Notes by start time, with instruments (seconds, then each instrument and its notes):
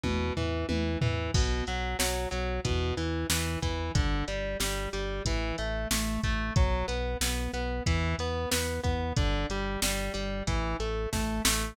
0.04 synth bass 1 E2, overdriven guitar B2, kick, high tom
0.37 synth bass 1 E2, overdriven guitar E3, floor tom
0.69 synth bass 1 E2, overdriven guitar E3, high tom
1.01 synth bass 1 E2, overdriven guitar E3, floor tom
1.34 synth bass 1 B1, overdriven guitar B2, kick, crash
1.67 synth bass 1 B1, overdriven guitar F#3, closed hi-hat
1.99 synth bass 1 B1, overdriven guitar F#3, snare
2.31 synth bass 1 B1, overdriven guitar F#3, closed hi-hat
2.65 synth bass 1 E2, overdriven guitar B2, kick, closed hi-hat
2.97 synth bass 1 E2, overdriven guitar E3, closed hi-hat
3.30 synth bass 1 E2, overdriven guitar E3, snare
3.62 synth bass 1 E2, overdriven guitar E3, kick, closed hi-hat
3.95 synth bass 1 G1, overdriven guitar D3, kick, closed hi-hat
4.28 synth bass 1 G1, overdriven guitar G3, closed hi-hat
4.60 synth bass 1 G1, overdriven guitar G3, snare
4.93 synth bass 1 G1, overdriven guitar G3, closed hi-hat
5.25 synth bass 1 A1, overdriven guitar E3, kick, closed hi-hat
5.58 synth bass 1 A1, overdriven guitar A3, closed hi-hat
5.91 synth bass 1 A1, overdriven guitar A3, snare
6.23 synth bass 1 A1, overdriven guitar A3, kick, closed hi-hat
6.56 synth bass 1 B1, overdriven guitar F#3, kick, closed hi-hat
6.88 synth bass 1 B1, overdriven guitar B3, closed hi-hat
7.21 synth bass 1 B1, overdriven guitar B3, snare
7.53 synth bass 1 B1, overdriven guitar B3, closed hi-hat
7.86 synth bass 1 E2, overdriven guitar E3, kick, closed hi-hat
8.19 synth bass 1 E2, overdriven guitar B3, closed hi-hat
8.51 synth bass 1 E2, overdriven guitar B3, snare
8.84 synth bass 1 E2, overdriven guitar B3, kick, closed hi-hat
9.17 synth bass 1 G1, overdriven guitar D3, kick, closed hi-hat
9.50 synth bass 1 G1, overdriven guitar G3, closed hi-hat
9.82 synth bass 1 G1, overdriven guitar G3, snare
10.14 synth bass 1 G1, overdriven guitar G3, closed hi-hat
10.47 synth bass 1 A1, overdriven guitar E3, kick, closed hi-hat
10.80 synth bass 1 A1, overdriven guitar A3, closed hi-hat
11.13 synth bass 1 A1, overdriven guitar A3, kick, snare
11.45 synth bass 1 A1, overdriven guitar A3, snare